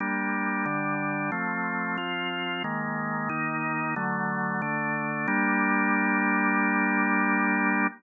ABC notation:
X:1
M:4/4
L:1/8
Q:1/4=91
K:Gm
V:1 name="Drawbar Organ"
[G,B,D]2 [D,G,D]2 [F,A,C]2 [F,CF]2 | [E,_A,B,]2 [E,B,E]2 [D,^F,=A,]2 [D,A,D]2 | [G,B,D]8 |]